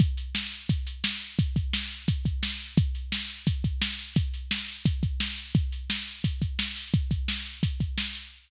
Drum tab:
HH |xx-xxx-x|xx-xxx-x|xx-xxx-x|xx-xxx-x|
SD |--o---o-|--o---o-|--o---o-|--o---o-|
BD |o---o---|oo--oo--|o---oo--|o---oo--|

HH |xx-xxx-o|xx-xxx-x|
SD |--o---o-|--o---o-|
BD |o---oo--|oo--oo--|